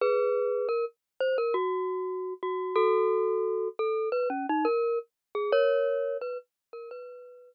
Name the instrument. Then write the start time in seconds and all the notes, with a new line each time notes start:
glockenspiel
0.01 G#4 B4
0.69 A#4
1.20 C5
1.38 A#4
1.54 F#4
2.43 F#4
2.76 F#4 A4
3.79 A4
4.12 B4
4.30 C#4
4.49 D#4
4.65 A#4
5.35 G#4
5.52 A#4 C#5
6.21 B4
6.73 A#4
6.91 B4